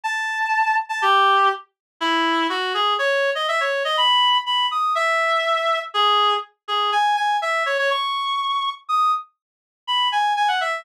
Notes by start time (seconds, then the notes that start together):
0.04 A5
0.89 A5
1.02 G4
2.01 E4
2.49 F#4
2.74 G#4
2.99 C#5
3.35 D#5
3.48 E5
3.60 C#5
3.85 D#5
3.97 B5
4.46 B5
4.71 D#6
4.95 E5
5.94 G#4
6.68 G#4
6.92 G#5
7.17 G#5
7.42 E5
7.66 C#5
7.78 C#5
7.90 C#6
8.89 D#6
9.87 B5
10.12 G#5
10.36 G#5
10.48 F#5
10.61 E5